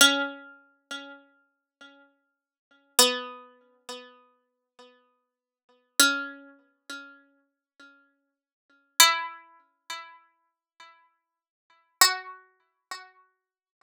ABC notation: X:1
M:3/4
L:1/8
Q:1/4=60
K:F#m
V:1 name="Harpsichord"
C6 | B,6 | C6 | E6 |
F4 z2 |]